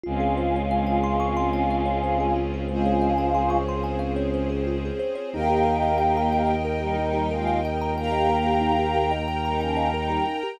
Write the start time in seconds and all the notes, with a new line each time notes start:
0.03 C#2 G#3 C4 C#4 F4 G#4
0.20 G#4
0.37 C5
0.56 C#5
0.71 F5
0.87 G#5
1.04 C6
1.20 C#6
1.37 C6
1.53 G#5
1.70 F5
1.86 C#5
2.04 C5
2.20 G#4
2.36 F4
2.54 G#4
2.68 G#3 C4 C#4 F4 G#4 C5
2.85 C#5
3.02 F5
3.18 G#5
3.34 C6
3.50 C#6
3.69 C6
3.84 G#5
3.99 F5
4.16 C#5
4.34 C5
4.50 G#4
4.67 F4
4.85 G#4
4.99 C5
5.15 C#5
5.33 D#2 A#3 D#4 G4 A#4 D#5 G5
5.49 G4
5.65 A#4
5.83 D#5
5.98 G5
6.17 A#5
6.32 G5
6.47 D#5
6.65 A#4
6.80 G3 D#4 G4
6.98 G3 D#4
7.13 G4
7.31 G#3 F4 A#4
7.47 D#5
7.65 G5
7.81 A#5
7.97 A#3 G4 A#4 G5 A#5
8.12 D#5
8.30 A#4
8.46 G4
8.61 D#4
8.79 G4
8.96 A#4
9.11 D#5
9.28 G5
9.45 G3 D#4 A#5
9.61 F3 C#4 G5
9.77 D#5
9.94 G3 D#4 A#4
10.10 G4
10.27 D#4
10.43 G4